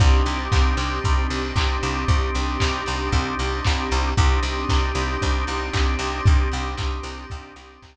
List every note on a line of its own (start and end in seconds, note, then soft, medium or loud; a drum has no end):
0.00 0.22 C2 loud
0.00 4.12 C4 medium
0.00 4.09 C4 medium
0.00 4.12 D4 medium
0.00 4.09 D4 medium
0.00 4.12 D#4 medium
0.00 4.09 D#4 medium
0.00 4.12 G4 medium
0.00 4.09 G4 medium
0.00 kick loud
0.00 crash loud
0.26 0.48 C2 medium
0.26 open hi-hat medium
0.52 0.74 C2 medium
0.52 kick loud
0.52 clap loud
0.77 0.99 C2 medium
0.77 open hi-hat medium
1.04 1.27 C2 medium
1.04 kick loud
1.04 closed hi-hat loud
1.30 1.52 C2 medium
1.30 open hi-hat loud
1.56 1.78 C2 medium
1.56 kick loud
1.56 clap loud
1.83 2.05 C2 medium
1.83 open hi-hat medium
2.08 2.30 C2 medium
2.08 kick loud
2.08 closed hi-hat loud
2.35 2.57 C2 medium
2.35 open hi-hat medium
2.60 2.84 C2 medium
2.60 kick medium
2.60 clap loud
2.86 3.10 C2 medium
2.86 open hi-hat medium
3.12 3.35 C2 medium
3.12 kick medium
3.12 closed hi-hat loud
3.39 3.61 C2 medium
3.39 open hi-hat medium
3.64 3.89 C2 medium
3.64 kick loud
3.64 clap loud
3.91 4.14 C2 loud
3.91 open hi-hat medium
4.17 4.40 C2 loud
4.17 7.96 C4 medium
4.17 7.96 D4 medium
4.17 7.96 D#4 medium
4.17 7.96 G4 medium
4.17 kick loud
4.17 closed hi-hat loud
4.43 4.65 C2 medium
4.43 open hi-hat medium
4.69 4.92 C2 medium
4.69 kick medium
4.69 clap loud
4.95 5.17 C2 medium
4.95 open hi-hat medium
5.22 5.44 C2 medium
5.22 kick medium
5.22 closed hi-hat loud
5.47 5.70 C2 medium
5.47 open hi-hat medium
5.73 5.96 C2 medium
5.73 kick medium
5.73 clap loud
5.99 6.21 C2 medium
5.99 open hi-hat medium
6.26 6.49 C2 medium
6.26 kick loud
6.26 closed hi-hat loud
6.52 6.75 C2 medium
6.52 open hi-hat medium
6.77 7.00 C2 medium
6.77 kick loud
6.77 clap loud
7.03 7.26 C2 medium
7.03 open hi-hat loud
7.30 7.53 C2 medium
7.30 kick loud
7.30 closed hi-hat loud
7.56 7.78 C2 medium
7.56 open hi-hat medium
7.82 7.96 C2 medium
7.82 kick medium
7.82 clap loud